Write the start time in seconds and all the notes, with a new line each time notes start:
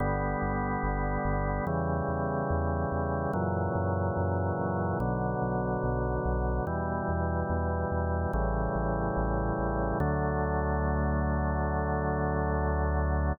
0.00 G1 D3 G3 B3
0.42 G1
0.83 G1
1.25 G1
1.66 E2 C#3 E3 G3
2.08 E2
2.50 E2
2.92 E2
3.33 F#2 A#2 C#3 E3 F#3
3.75 F#2
4.17 F#2
4.59 F#2
5.00 B1 B2 D3 F#3
5.42 B1
5.84 B1
6.25 B1
6.66 E2 B2 E3 G3
7.09 E2
7.50 E2
7.91 E2
8.33 A1 A2 C#3 E3 G3
8.75 A1
9.17 A1
9.59 A1
10.00 D2 D3 F#3 A3